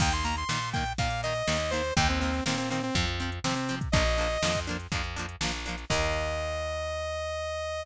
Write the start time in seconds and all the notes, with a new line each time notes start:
0.00 D#2 D#3 A#3 G5, kick, crash
0.12 C6, closed hi-hat
0.24 D#3 A#3 A#5, closed hi-hat
0.37 C6, closed hi-hat
0.49 A#2 D#3 A#3, snare
0.73 D#3 A#3 G5, kick, closed hi-hat
0.86 closed hi-hat
0.98 A#2 D#3 A#3 F5, kick, closed hi-hat
1.10 closed hi-hat
1.23 D#3 A#3 D#5, closed hi-hat
1.35 closed hi-hat
1.47 D#2 D#3 A#3, snare
1.60 closed hi-hat
1.71 D#3 A#3 C5, closed hi-hat
1.84 closed hi-hat
1.96 D#2 D#3 A#3 G5, kick, closed hi-hat
2.09 C4, closed hi-hat
2.20 D#3 A#3 C4, closed hi-hat
2.34 closed hi-hat
2.46 A#2 D#3 A#3 C4, snare
2.58 C4, closed hi-hat
2.70 D#3 A#3 C4, closed hi-hat
2.83 C4, closed hi-hat
2.95 F2 F3 C4, kick, closed hi-hat
3.07 closed hi-hat
3.20 F3 C4, closed hi-hat
3.32 closed hi-hat
3.44 C3 F3 C4, snare
3.55 C4, closed hi-hat
3.69 F3 C4, closed hi-hat
3.81 kick, closed hi-hat
3.92 A#1 A#3 D4 D#5, kick, closed hi-hat
3.96 F3
4.06 closed hi-hat
4.18 F3 A#3 D4, closed hi-hat
4.30 closed hi-hat
4.42 F2 F3 A#3 D4, snare
4.55 kick, closed hi-hat
4.67 F3 A#3 D4, closed hi-hat
4.80 closed hi-hat
4.92 F2 F3 A#3 D4, kick, closed hi-hat
5.04 closed hi-hat
5.16 F3 A#3 D4, closed hi-hat
5.29 closed hi-hat
5.41 A#1 F3 A#3 D4, snare
5.53 closed hi-hat
5.66 F3 A#3 D4, closed hi-hat
5.78 closed hi-hat
5.90 D#2 D#3 A#3 D#5, kick, crash